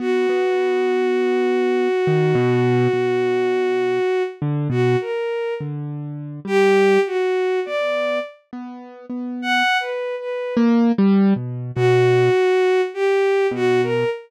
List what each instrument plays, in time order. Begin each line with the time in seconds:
0.00 acoustic grand piano B3, violin F#4
0.29 acoustic grand piano B3
2.07 acoustic grand piano D#3
2.35 acoustic grand piano B2
2.93 acoustic grand piano B2
4.42 acoustic grand piano D3
4.70 acoustic grand piano B2, violin F#4
5.01 violin A#4
5.61 acoustic grand piano D3
6.45 acoustic grand piano G3, violin G4
7.07 violin F#4
7.66 acoustic grand piano B3, violin D5
8.53 acoustic grand piano B3
9.10 acoustic grand piano B3
9.42 violin F#5
9.80 violin B4
10.19 violin B4
10.57 acoustic grand piano A#3
10.98 acoustic grand piano G3
11.36 acoustic grand piano B2
11.75 acoustic grand piano B2, violin F#4
12.94 violin G4
13.51 acoustic grand piano B2, violin F#4
13.83 violin A#4